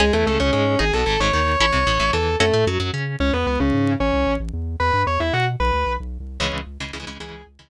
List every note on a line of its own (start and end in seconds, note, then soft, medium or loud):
0.00 0.11 C#2 medium
0.00 0.12 G#3 loud
0.00 0.05 C#4 medium
0.00 0.05 G#4 medium
0.00 0.12 G#4 loud
0.13 0.25 E2 medium
0.13 0.25 E3 medium
0.13 0.26 A3 medium
0.13 0.26 A4 loud
0.26 0.38 C#2 medium
0.26 0.39 C#3 medium
0.26 0.38 A3 medium
0.26 0.38 A4 medium
0.40 0.52 C#2 medium
0.40 0.51 C#3 medium
0.40 0.52 C#4 medium
0.40 0.52 C#5 medium
0.53 0.76 G#2 medium
0.53 0.75 G#3 medium
0.53 0.78 C#4 medium
0.53 0.78 C#5 loud
0.79 0.91 G#1 loud
0.79 0.84 D#4 loud
0.79 0.84 G#4 medium
0.79 0.92 G#4 loud
0.79 0.92 G#5 loud
0.93 1.05 B1 medium
0.93 1.05 B2 medium
0.93 1.05 A4 medium
0.93 1.05 A5 loud
1.06 1.18 G#1 medium
1.06 1.17 G#2 medium
1.06 1.19 A4 loud
1.06 1.19 A5 loud
1.20 1.31 G#1 medium
1.20 1.32 G#2 medium
1.20 1.32 C#5 medium
1.20 1.32 C#6 loud
1.33 1.56 D#2 medium
1.33 1.56 D#3 medium
1.33 1.59 C#5 medium
1.33 1.59 C#6 loud
1.60 1.71 A1 medium
1.60 1.66 C#4 medium
1.60 1.66 E4 loud
1.60 1.66 A4 medium
1.60 2.10 C#5 loud
1.60 2.10 C#6 loud
1.73 1.85 C2 medium
1.73 1.84 C3 medium
1.87 1.98 A1 medium
1.87 1.98 A2 medium
2.00 2.11 A1 medium
2.00 2.11 A2 medium
2.13 2.36 E2 medium
2.13 2.36 E3 medium
2.13 2.36 A4 medium
2.13 2.36 A5 medium
2.40 2.51 F#2 medium
2.40 2.64 A3 loud
2.40 2.46 C#4 loud
2.40 2.46 F#4 loud
2.40 2.64 A4 loud
2.40 2.46 A4 medium
2.53 2.65 A2 medium
2.53 2.65 A3 medium
2.67 2.78 F#2 medium
2.67 2.79 F#3 medium
2.80 2.91 F#2 medium
2.80 2.91 F#3 medium
2.93 3.16 C#3 medium
2.93 3.16 C#4 medium
3.20 3.31 C#2 medium
3.20 3.32 C#4 loud
3.20 3.32 C#5 loud
3.33 3.45 E2 medium
3.33 3.46 B3 medium
3.33 3.46 B4 loud
3.47 3.58 C#2 medium
3.47 3.58 B3 medium
3.47 3.58 B4 loud
3.60 3.71 C#2 medium
3.60 3.93 C#3 medium
3.60 3.93 C#4 loud
3.73 3.96 G#2 medium
4.00 4.12 A1 medium
4.00 4.33 C#4 loud
4.00 4.33 C#5 loud
4.14 4.25 C2 medium
4.27 4.38 A1 medium
4.40 4.51 A1 medium
4.53 4.76 E2 medium
4.80 4.91 E2 medium
4.80 5.02 B4 loud
4.80 5.02 B5 loud
4.93 5.05 G2 medium
5.07 5.18 E2 medium
5.07 5.19 C#5 medium
5.07 5.19 C#6 medium
5.20 5.31 E2 medium
5.20 5.33 E4 medium
5.20 5.33 E5 loud
5.33 5.56 B2 medium
5.33 5.45 F#4 loud
5.33 5.45 F#5 loud
5.60 5.71 B1 medium
5.60 5.93 B4 medium
5.60 5.93 B5 loud
5.73 5.84 D2 medium
5.86 5.98 B1 medium
6.00 6.18 B1 medium
6.20 6.38 C2 medium
6.40 6.51 C#2 medium
6.40 6.61 C#3 loud
6.40 6.61 E3 loud
6.40 6.61 G#3 loud
6.40 6.51 C#4 loud
6.40 6.51 C#5 loud
6.53 6.65 C#2 medium
6.67 6.78 C#2 medium
6.80 6.91 C#2 medium
6.80 6.91 C#3 medium
6.80 6.91 E3 medium
6.80 6.91 G#3 medium
6.93 7.05 C#2 medium
6.93 6.99 C#3 medium
6.93 6.99 E3 medium
6.93 6.99 G#3 medium
7.00 7.05 C#3 loud
7.00 7.05 E3 loud
7.00 7.05 G#3 medium
7.07 7.18 C#2 medium
7.07 7.18 C#3 loud
7.07 7.18 E3 medium
7.07 7.18 G#3 loud
7.20 7.31 C#2 medium
7.20 7.42 C#3 loud
7.20 7.42 E3 loud
7.20 7.42 G#3 loud
7.20 7.44 G#4 loud
7.20 7.44 G#5 loud
7.33 7.44 C#2 medium
7.47 7.58 C#2 medium
7.59 7.69 C#2 medium
7.59 7.69 C#3 medium
7.59 7.69 E3 medium
7.59 7.69 G#3 medium